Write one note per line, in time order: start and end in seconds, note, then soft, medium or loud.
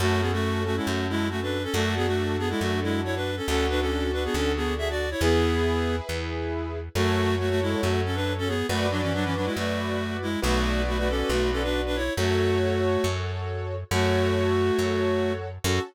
0.00 0.80 F#2 medium
0.00 0.21 A3 loud
0.00 1.57 C#4 loud
0.00 0.21 F#4 loud
0.00 1.57 F#4 medium
0.00 1.57 A4 loud
0.21 0.31 B3 medium
0.21 0.31 G#4 medium
0.33 0.63 A3 loud
0.33 0.63 F#4 loud
0.65 0.76 A3 medium
0.65 0.76 F#4 loud
0.76 0.87 G#3 medium
0.76 0.87 E4 medium
0.86 1.67 F#2 medium
0.86 1.06 A3 medium
0.86 1.06 F#4 medium
1.09 1.28 G#3 loud
1.09 1.28 E4 loud
1.30 1.40 A3 medium
1.30 1.40 F#4 loud
1.42 1.63 D4 medium
1.42 1.63 B4 medium
1.63 1.73 C#4 medium
1.63 1.73 A4 loud
1.74 2.54 F#2 medium
1.74 1.95 A3 loud
1.74 3.31 D4 loud
1.74 1.95 F#4 loud
1.74 3.31 F#4 loud
1.74 3.31 A4 loud
1.96 2.06 B3 loud
1.96 2.06 G#4 loud
2.07 2.36 A3 medium
2.07 2.36 F#4 loud
2.39 2.49 B3 medium
2.39 2.49 G#4 loud
2.50 2.60 G#3 loud
2.50 2.60 E4 loud
2.61 3.41 F#2 medium
2.61 2.80 A3 medium
2.61 2.80 F#4 loud
2.83 3.01 G#3 medium
2.83 3.01 E4 loud
3.04 3.15 E4 medium
3.04 3.15 C#5 loud
3.16 3.36 D4 medium
3.16 3.36 B4 medium
3.37 3.47 C#4 medium
3.37 3.47 A4 medium
3.48 4.28 D2 medium
3.48 3.66 C#4 loud
3.48 5.05 D4 loud
3.48 5.05 F#4 loud
3.48 3.66 A4 loud
3.48 5.05 A4 loud
3.70 3.80 D4 loud
3.70 3.80 B4 loud
3.81 4.11 C#4 medium
3.81 4.11 A4 medium
4.13 4.23 D4 medium
4.13 4.23 B4 loud
4.25 4.35 B3 medium
4.25 4.35 G#4 loud
4.34 5.14 D2 medium
4.34 4.52 C#4 medium
4.34 4.52 A4 loud
4.56 4.74 B3 medium
4.56 4.74 G#4 loud
4.78 4.88 G#4 loud
4.78 4.88 E5 loud
4.90 5.09 F#4 medium
4.90 5.09 D5 loud
5.11 5.21 E4 medium
5.11 5.21 C#5 loud
5.21 6.01 E2 medium
5.21 5.96 B3 loud
5.21 6.78 E4 loud
5.21 6.78 G#4 loud
5.21 5.96 G#4 loud
5.21 6.78 B4 loud
6.09 6.89 E2 medium
6.95 7.75 F#2 medium
6.95 7.35 A3 loud
6.95 7.35 F#4 loud
6.95 8.52 F#4 loud
6.95 8.52 A4 loud
6.95 8.52 C#5 loud
7.39 7.49 A3 medium
7.39 7.49 F#4 loud
7.50 7.60 A3 loud
7.50 7.60 F#4 loud
7.62 7.81 G#3 medium
7.62 7.81 E4 loud
7.82 8.63 F#2 medium
7.82 8.01 A3 medium
7.82 8.01 F#4 loud
8.05 8.15 C#4 medium
8.05 8.15 A4 medium
8.15 8.33 D4 medium
8.15 8.33 B4 loud
8.38 8.48 C#4 loud
8.38 8.48 A4 loud
8.48 8.66 B3 loud
8.48 8.66 G#4 loud
8.69 9.49 F#2 medium
8.69 8.87 A3 loud
8.69 10.26 F#4 loud
8.69 8.87 F#4 loud
8.69 10.26 B4 loud
8.69 10.26 D5 loud
8.91 9.01 F#3 medium
8.91 9.01 D4 loud
9.02 9.12 E3 medium
9.02 9.12 C#4 loud
9.14 9.24 F#3 loud
9.14 9.24 D4 loud
9.24 9.35 E3 medium
9.24 9.35 C#4 loud
9.36 9.46 F#3 medium
9.36 9.46 D4 medium
9.45 9.55 G#3 medium
9.45 9.55 E4 medium
9.56 10.36 F#2 medium
9.56 10.17 A3 loud
9.56 10.17 F#4 loud
10.22 10.40 G#3 medium
10.22 10.40 E4 loud
10.42 11.23 B1 medium
10.42 10.82 A3 loud
10.42 11.99 F#4 loud
10.42 10.82 F#4 loud
10.42 11.99 B4 loud
10.42 11.99 D5 loud
10.87 10.98 A3 medium
10.87 10.98 F#4 loud
10.98 11.08 A3 medium
10.98 11.08 F#4 loud
11.09 11.31 C#4 medium
11.09 11.31 A4 loud
11.29 12.10 B1 medium
11.29 11.50 A3 medium
11.29 11.50 F#4 loud
11.52 11.62 C#4 medium
11.52 11.62 A4 loud
11.63 11.81 D4 medium
11.63 11.81 B4 loud
11.86 11.96 D4 medium
11.86 11.96 B4 loud
11.96 12.13 E4 medium
11.96 12.13 C#5 loud
12.17 12.97 F#2 medium
12.17 13.06 A3 medium
12.17 13.06 F#4 loud
12.17 13.75 F#4 loud
12.17 13.75 A4 loud
12.17 13.75 C#5 loud
13.04 13.84 F#2 medium
13.91 14.71 F#2 medium
13.91 15.33 A3 loud
13.91 15.48 F#4 loud
13.91 15.33 F#4 loud
13.91 15.48 A4 loud
13.91 15.48 C#5 loud
14.79 15.59 F#2 medium
15.64 15.79 F#2 loud
15.64 15.81 C#4 medium
15.64 15.81 F#4 loud
15.64 15.81 A4 loud